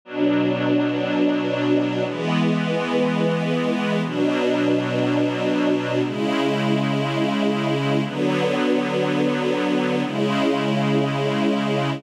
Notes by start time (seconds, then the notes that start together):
0.05 B2 F#3 D4
2.03 E3 G#3 B3
4.04 B2 F#3 D4
6.04 C#3 G#3 E4
8.05 D3 F#3 B3
10.04 C#3 G#3 E4